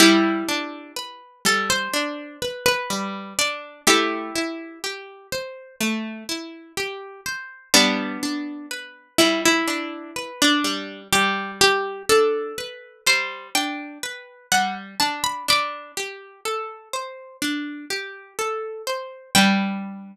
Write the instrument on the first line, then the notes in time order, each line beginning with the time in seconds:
orchestral harp
0.00 G3 E4 G4
0.49 D4
0.96 B4
1.45 G3 A4
1.70 C5
1.94 D4
2.42 B4
2.66 B4
2.90 G3
3.39 D4 D5
3.87 A3 E4 G4
4.35 E4
4.84 G4
5.32 C5
5.80 A3
6.29 E4
6.77 G4
7.26 C5
7.74 G3 B3 D4
8.23 D4
8.71 B4
9.18 G3 E4
9.45 E4
9.68 D4
10.16 B4
10.42 D4
10.64 G3
11.13 G3 G4
11.61 G4
12.09 D4 A4
12.58 B4
13.06 G3 C5
13.55 D4 G5
14.03 B4
14.52 G3 F#5
15.00 D4 A5
15.24 B5
15.48 D4 B5 D6
15.97 G4
16.45 A4
16.93 C5
17.42 D4
17.90 G4
18.39 A4
18.87 C5
19.35 G3 D4 B4 G5